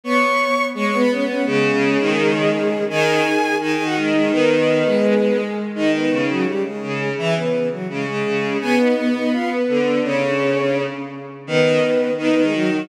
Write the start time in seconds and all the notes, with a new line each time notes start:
0.04 B3 C#5 C#6
0.74 G#3 C#5 C#6
0.86 C#5 C#6
0.93 B3
0.99 B4 B5
1.10 C#4 C#5
1.28 C#4 C#5
1.46 C#3 G#3 G#4
1.73 C#3
2.00 D#3
2.90 D#3 G#4 G#5
3.61 D#3 G#4 G#5
3.72 G#4 G#5
3.79 D#3
3.85 F#4 F#5
3.96 G#3 G#4
4.14 G#3 G#4
4.31 D#3 B3 B4
4.86 G#3
5.75 D#3 D#4 D#5
5.94 B3 B4
6.10 C#3
6.29 F#3 F#4
6.47 G3 G4
6.64 G#3 G#4
6.82 C#3
7.18 E3 E4 E5
7.35 B3 B4
7.71 F#3 F#4
7.89 C#3 G#3 G#4
8.06 C#3 G#3 G#4
8.25 C#3
8.61 B3 G#4 G#5
8.79 D#4 D#5
8.96 B3
9.15 D#4 D#5
9.32 F4 F5
9.50 B3 B4
9.68 D3
10.03 C#3 C#4 C#5
11.47 D#3 B3 B4
12.17 D#3 B3 B4
12.30 B3 B4
12.36 D#3
12.42 G#3 G#4
12.53 F#3 F#4
12.71 F#3 F#4